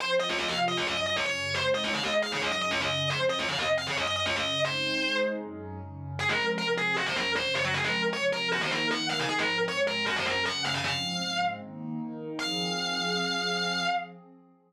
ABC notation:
X:1
M:4/4
L:1/16
Q:1/4=155
K:Fphr
V:1 name="Distortion Guitar"
c z e d e f z e d e e e d d3 | c z e d f e z f d e e e d e3 | c z e d f e z f d e e e d e3 | c6 z10 |
A B2 z B z A2 G c B2 c2 d G | A B2 z d z B2 G c B2 g2 f a | A B2 z d z B2 G c B2 g2 f a | f6 z10 |
f16 |]
V:2 name="Pad 2 (warm)"
[F,CF]4 [C,F,F]4 [G,,G,D]4 [G,,D,D]4 | [A,CE]4 [A,EA]4 [G,,G,D]4 [G,,D,D]4 | [F,,F,C]4 [F,,C,C]4 [G,,G,D]4 [G,,D,D]4 | [A,CE]4 [A,EA]4 [G,,G,D]4 [G,,D,D]4 |
[F,A,C]4 [C,F,C]4 [G,,G,D]4 [G,,D,D]4 | [F,A,C]4 [C,F,C]4 [E,B,E]4 [E,EB]4 | [A,,F,C]4 [A,,A,C]4 [G,,G,D]4 [G,,D,D]4 | [A,,F,C]4 [A,,A,C]4 [E,B,E]4 [E,EB]4 |
[F,CA]16 |]